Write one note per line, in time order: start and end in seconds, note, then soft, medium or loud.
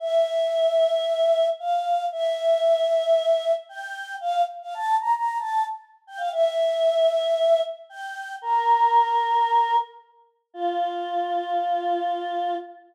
0.00 1.47 E5 loud
1.59 2.06 F5 loud
2.12 3.52 E5 loud
3.69 4.14 G5 loud
4.21 4.42 F5 loud
4.62 4.75 F5 loud
4.74 4.95 A5 loud
5.00 5.13 A#5 loud
5.15 5.38 A#5 medium
5.38 5.64 A5 loud
6.07 6.20 G5 loud
6.17 6.30 F5 loud
6.32 7.60 E5 loud
7.89 8.34 G5 loud
8.42 9.76 A#4 loud
10.54 12.55 F4 loud